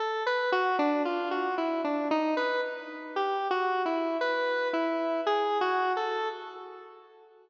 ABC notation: X:1
M:3/4
L:1/16
Q:1/4=57
K:none
V:1 name="Lead 1 (square)"
A B ^F D =F ^F E D ^D B z2 | (3G2 ^F2 E2 B2 E2 (3^G2 F2 A2 |]